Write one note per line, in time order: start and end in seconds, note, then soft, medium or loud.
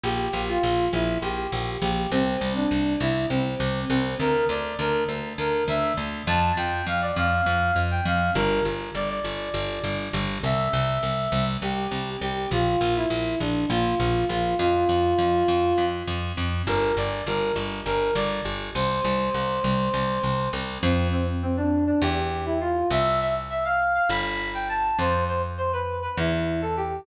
0.04 0.29 A#1 medium
0.04 0.43 G4 loud
0.33 0.58 A#1 medium
0.48 0.86 F4 loud
0.63 0.88 A#1 medium
0.93 1.18 A#1 medium
0.93 1.18 E4 loud
1.22 1.48 A#1 medium
1.22 1.72 G4 loud
1.52 1.77 A#1 medium
1.82 2.07 A#1 medium
1.82 2.11 G4 loud
2.11 2.37 C2 medium
2.11 2.53 C4 loud
2.41 2.66 C2 medium
2.56 2.94 D4 loud
2.71 2.96 C2 medium
3.00 3.26 C2 medium
3.00 3.27 E4 loud
3.30 3.55 C2 medium
3.30 3.80 C4 loud
3.60 3.85 C2 medium
3.89 4.15 C2 medium
3.89 4.17 C4 loud
4.20 4.45 D2 medium
4.20 4.47 A#4 loud
4.49 4.74 D2 medium
4.49 4.77 D5 medium
4.79 5.04 D2 medium
4.79 5.03 A#4 loud
5.09 5.34 D2 medium
5.38 5.63 D2 medium
5.38 5.64 A#4 loud
5.68 5.93 D2 medium
5.68 5.93 E5 loud
5.97 6.23 D2 medium
6.27 6.52 F2 loud
6.27 6.52 A5 loud
6.57 6.82 F2 medium
6.57 6.85 G5 medium
6.87 7.12 F2 medium
6.87 7.01 F5 loud
7.02 7.16 D5 loud
7.16 7.42 F2 medium
7.16 7.80 F5 loud
7.46 7.72 F2 medium
7.76 8.01 F2 medium
7.91 8.05 G5 medium
8.05 8.31 F2 medium
8.05 8.31 F5 loud
8.35 8.61 G1 loud
8.35 8.64 A#4 loud
8.65 8.90 G1 medium
8.95 9.20 G1 medium
8.95 9.09 D5 loud
9.10 9.98 D5 medium
9.24 9.50 G1 medium
9.54 9.79 G1 medium
9.84 10.09 G1 medium
10.13 10.39 G1 medium
10.43 10.69 C2 medium
10.43 11.45 E5 loud
10.73 10.98 C2 medium
11.03 11.28 C2 medium
11.32 11.57 C2 medium
11.62 11.87 C2 medium
11.62 12.10 G4 medium
11.91 12.17 C2 medium
12.21 12.47 C2 medium
12.21 12.49 G4 loud
12.51 12.76 A#1 medium
12.51 12.94 F4 loud
12.81 13.06 A#1 medium
12.96 13.39 E4 loud
13.10 13.36 A#1 medium
13.40 13.66 A#1 medium
13.40 13.65 D4 medium
13.70 13.95 A#1 medium
13.70 14.25 F4 medium
14.00 14.25 A#1 medium
14.29 14.55 A#1 medium
14.29 14.56 F4 loud
14.59 14.85 F2 medium
14.59 15.85 F4 loud
14.89 15.14 F2 medium
15.18 15.44 F2 medium
15.48 15.74 F2 medium
15.78 16.03 F2 medium
16.08 16.33 F2 medium
16.37 16.63 F2 medium
16.67 16.92 G1 medium
16.67 16.95 A#4 loud
16.97 17.22 G1 medium
16.97 17.24 D5 loud
17.27 17.52 G1 medium
17.27 17.54 A#4 loud
17.56 17.81 G1 medium
17.86 18.11 G1 medium
17.86 18.14 A#4 loud
18.15 18.41 G1 medium
18.15 18.42 D5 loud
18.45 18.70 G1 medium
18.74 19.00 C2 medium
18.74 20.49 C5 loud
19.04 19.30 C2 medium
19.34 19.60 C2 medium
19.64 19.89 C2 medium
19.94 20.19 C2 medium
20.23 20.49 C2 medium
20.53 20.78 C2 medium
20.83 21.92 F2 loud
20.83 21.08 C4 loud
21.12 21.27 C4 medium
21.42 21.57 C4 loud
21.57 21.85 D4 loud
21.87 22.01 D4 loud
22.02 22.84 E2 loud
22.02 22.45 G4 loud
22.46 22.60 E4 loud
22.61 22.88 F4 loud
22.91 24.00 C2 medium
22.91 23.20 E5 loud
23.20 23.34 E5 loud
23.50 23.64 E5 loud
23.65 23.94 F5 loud
23.95 24.09 F5 loud
24.09 24.91 G1 medium
24.09 24.49 B5 loud
24.54 24.68 G5 medium
24.69 24.98 A5 loud
24.99 26.08 F2 medium
24.99 25.24 C5 loud
25.28 25.42 C5 loud
25.58 25.72 C5 loud
25.73 25.97 B4 loud
26.02 26.16 B4 loud
26.17 27.00 E2 loud
26.17 26.61 E4 loud
26.62 26.76 A4 medium
26.77 27.01 G4 loud